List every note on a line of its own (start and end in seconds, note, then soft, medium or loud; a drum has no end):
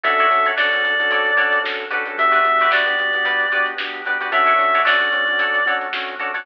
0.03 0.27 D2 loud
0.03 0.26 C#4 medium
0.03 0.26 D4 loud
0.03 0.15 F#4 medium
0.03 0.26 F#4 medium
0.03 0.15 A4 medium
0.03 0.26 A4 loud
0.03 0.15 C#5 medium
0.03 0.15 D5 medium
0.03 0.48 E5 medium
0.03 kick loud
0.03 closed hi-hat loud
0.18 0.40 F#4 medium
0.18 0.40 A4 medium
0.18 0.40 C#5 medium
0.18 0.40 D5 medium
0.18 closed hi-hat medium
0.30 0.77 F2 medium
0.30 0.52 C#4 medium
0.30 0.52 D4 medium
0.30 0.52 F#4 medium
0.30 0.52 A4 medium
0.30 snare soft
0.30 closed hi-hat medium
0.45 0.55 F#4 medium
0.45 0.55 A4 medium
0.45 0.55 C#5 medium
0.45 0.55 D5 medium
0.45 closed hi-hat medium
0.57 0.70 C#4 medium
0.57 0.70 D4 medium
0.57 1.01 F#4 medium
0.57 0.70 F#4 medium
0.57 1.01 A4 medium
0.57 0.70 A4 medium
0.57 1.01 C#5 medium
0.57 1.61 D5 medium
0.57 1.01 D5 medium
0.57 snare loud
0.71 0.82 C#4 medium
0.71 0.82 D4 medium
0.71 0.82 F#4 medium
0.71 0.82 A4 medium
0.71 snare medium
0.71 closed hi-hat medium
0.83 1.07 F2 medium
0.83 0.95 C#4 medium
0.83 0.95 D4 medium
0.83 0.95 F#4 medium
0.83 0.95 A4 medium
0.83 snare soft
0.83 closed hi-hat medium
0.99 1.31 C#4 medium
0.99 1.31 D4 medium
0.99 1.31 F#4 medium
0.99 1.31 A4 medium
0.99 closed hi-hat medium
1.11 1.58 D2 medium
1.11 1.33 F#4 medium
1.11 1.33 A4 medium
1.11 1.33 C#5 medium
1.11 1.33 D5 medium
1.11 kick medium
1.11 closed hi-hat loud
1.25 closed hi-hat medium
1.37 1.59 C#4 medium
1.37 1.59 D4 medium
1.37 1.81 F#4 medium
1.37 1.59 F#4 medium
1.37 1.81 A4 medium
1.37 1.59 A4 medium
1.37 1.81 C#5 medium
1.37 1.81 D5 medium
1.37 kick loud
1.37 closed hi-hat loud
1.52 closed hi-hat medium
1.63 2.12 D3 medium
1.63 1.85 C#4 medium
1.63 1.85 D4 medium
1.63 1.85 F#4 medium
1.63 1.85 A4 medium
1.63 snare loud
1.79 closed hi-hat medium
1.91 2.04 C#4 medium
1.91 2.04 D4 medium
1.91 2.29 F#4 medium
1.91 2.04 F#4 medium
1.91 2.29 G4 medium
1.91 2.04 A4 medium
1.91 2.29 B4 medium
1.91 2.29 D5 medium
1.91 snare soft
1.91 closed hi-hat medium
2.05 2.16 C#4 medium
2.05 2.16 D4 medium
2.05 2.16 F#4 medium
2.05 2.16 A4 medium
2.05 closed hi-hat medium
2.18 2.42 D2 loud
2.18 2.40 B3 medium
2.18 2.40 D4 loud
2.18 2.40 F#4 medium
2.18 2.40 G4 medium
2.18 2.71 E5 loud
2.18 kick loud
2.18 closed hi-hat loud
2.31 2.52 F#4 medium
2.31 2.52 G4 medium
2.31 2.52 B4 medium
2.31 2.52 D5 medium
2.31 closed hi-hat medium
2.45 2.92 F2 medium
2.45 2.67 B3 medium
2.45 2.67 D4 medium
2.45 2.67 F#4 medium
2.45 2.67 G4 medium
2.45 closed hi-hat medium
2.59 2.70 F#4 medium
2.59 2.70 G4 medium
2.59 2.70 B4 medium
2.59 2.71 D5 medium
2.59 snare soft
2.59 closed hi-hat medium
2.70 2.84 B3 medium
2.70 2.84 D4 medium
2.70 3.14 F#4 medium
2.70 2.84 F#4 medium
2.70 3.14 G4 medium
2.70 2.84 G4 medium
2.70 3.14 B4 medium
2.70 3.14 D5 medium
2.70 3.67 D5 medium
2.70 snare loud
2.86 2.95 B3 medium
2.86 2.95 D4 medium
2.86 2.95 F#4 medium
2.86 2.95 G4 medium
2.86 snare medium
2.86 closed hi-hat medium
2.98 3.22 F2 medium
2.98 3.11 B3 medium
2.98 3.11 D4 medium
2.98 3.11 F#4 medium
2.98 3.11 G4 medium
2.98 closed hi-hat medium
3.13 3.46 B3 medium
3.13 3.46 D4 medium
3.13 3.46 F#4 medium
3.13 3.46 G4 medium
3.13 closed hi-hat medium
3.25 3.72 D2 medium
3.25 3.47 F#4 medium
3.25 3.47 G4 medium
3.25 3.47 B4 medium
3.25 3.47 D5 medium
3.25 kick loud
3.25 closed hi-hat loud
3.40 closed hi-hat medium
3.52 3.74 B3 medium
3.52 3.74 D4 medium
3.52 3.96 F#4 medium
3.52 3.74 F#4 medium
3.52 3.74 G4 medium
3.52 3.96 G4 medium
3.52 3.96 B4 medium
3.52 3.96 D5 medium
3.52 closed hi-hat medium
3.66 closed hi-hat medium
3.78 4.26 D3 medium
3.78 4.02 B3 medium
3.78 4.02 D4 medium
3.78 4.02 F#4 medium
3.78 4.02 G4 medium
3.78 snare loud
3.93 closed hi-hat medium
4.05 4.18 B3 medium
4.05 4.18 D4 medium
4.05 4.18 F#4 medium
4.05 4.18 G4 medium
4.05 4.18 B4 medium
4.05 4.18 D5 medium
4.05 closed hi-hat medium
4.20 4.30 B3 medium
4.20 4.30 D4 medium
4.20 4.30 F#4 medium
4.20 4.31 F#4 medium
4.20 4.30 G4 medium
4.20 4.31 G4 medium
4.20 4.31 B4 medium
4.20 4.31 D5 medium
4.20 closed hi-hat medium
4.32 4.56 D2 loud
4.32 4.53 A3 medium
4.32 4.53 C#4 loud
4.32 4.53 D4 medium
4.32 4.53 F#4 loud
4.32 4.44 F#4 medium
4.32 4.44 A4 medium
4.32 4.44 C#5 medium
4.32 4.44 D5 medium
4.32 4.82 E5 loud
4.32 kick loud
4.32 closed hi-hat loud
4.46 4.67 F#4 medium
4.46 4.67 A4 medium
4.46 4.67 C#5 medium
4.46 4.67 D5 medium
4.46 closed hi-hat medium
4.58 5.06 F2 medium
4.58 4.80 A3 medium
4.58 4.80 C#4 medium
4.58 4.80 D4 medium
4.58 4.80 F#4 medium
4.58 snare soft
4.58 closed hi-hat medium
4.74 4.84 F#4 medium
4.74 4.84 A4 medium
4.74 4.84 C#5 medium
4.74 4.84 D5 medium
4.74 closed hi-hat medium
4.85 4.98 A3 medium
4.85 4.98 C#4 medium
4.85 4.98 D4 medium
4.85 5.29 F#4 medium
4.85 4.98 F#4 medium
4.85 5.29 A4 medium
4.85 5.29 C#5 medium
4.85 5.73 D5 medium
4.85 5.29 D5 medium
4.85 snare loud
5.00 5.10 A3 medium
5.00 5.10 C#4 medium
5.00 5.10 D4 medium
5.00 5.10 F#4 medium
5.00 snare medium
5.00 closed hi-hat medium
5.12 5.36 F2 medium
5.12 5.24 A3 medium
5.12 5.24 C#4 medium
5.12 5.24 D4 medium
5.12 5.24 F#4 medium
5.12 closed hi-hat medium
5.27 5.59 A3 medium
5.27 5.59 C#4 medium
5.27 5.59 D4 medium
5.27 5.59 F#4 medium
5.27 closed hi-hat medium
5.39 5.86 D2 medium
5.39 5.61 F#4 medium
5.39 5.61 A4 medium
5.39 5.61 C#5 medium
5.39 5.61 D5 medium
5.39 kick loud
5.39 closed hi-hat loud
5.54 closed hi-hat medium
5.66 5.88 A3 medium
5.66 5.88 C#4 medium
5.66 5.88 D4 medium
5.66 5.88 F#4 medium
5.66 6.11 F#4 medium
5.66 6.11 A4 medium
5.66 6.11 C#5 medium
5.66 6.11 D5 medium
5.66 kick medium
5.66 closed hi-hat medium
5.81 closed hi-hat medium
5.93 6.40 D3 medium
5.93 6.15 A3 medium
5.93 6.15 C#4 medium
5.93 6.15 D4 medium
5.93 6.15 F#4 medium
5.93 snare loud
6.08 closed hi-hat medium
6.19 6.32 A3 medium
6.19 6.32 C#4 medium
6.19 6.32 D4 medium
6.19 6.31 F#4 medium
6.19 6.32 F#4 medium
6.19 6.31 A4 medium
6.19 6.31 C#5 medium
6.19 6.31 D5 medium
6.19 closed hi-hat medium
6.34 6.45 A3 medium
6.34 6.45 C#4 medium
6.34 6.45 D4 medium
6.34 6.44 F#4 medium
6.34 6.45 F#4 medium
6.34 6.44 A4 medium
6.34 6.44 C#5 medium
6.34 6.44 D5 medium
6.34 open hi-hat medium